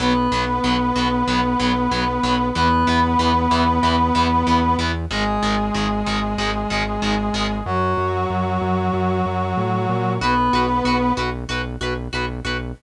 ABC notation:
X:1
M:4/4
L:1/8
Q:1/4=94
K:B
V:1 name="Brass Section"
[B,B]8 | [B,B]8 | [G,G]8 | [F,F]8 |
[B,B]3 z5 |]
V:2 name="Overdriven Guitar"
[F,B,] [F,B,] [F,B,] [F,B,] [F,B,] [F,B,] [F,B,] [F,B,] | [E,B,] [E,B,] [E,B,] [E,B,] [E,B,] [E,B,] [E,B,] [E,B,] | [D,G,] [D,G,] [D,G,] [D,G,] [D,G,] [D,G,] [D,G,] [D,G,] | z8 |
[FB] [FB] [FB] [FB] [FB] [FB] [FB] [FB] |]
V:3 name="Synth Bass 1" clef=bass
B,,, B,,, B,,, B,,, B,,, B,,, B,,, B,,, | E,, E,, E,, E,, E,, E,, E,, E,, | G,,, G,,, G,,, G,,, G,,, G,,, G,,, G,,, | F,, F,, F,, F,, F,, F,, =A,, ^A,, |
B,,, B,,, B,,, B,,, B,,, B,,, B,,, B,,, |]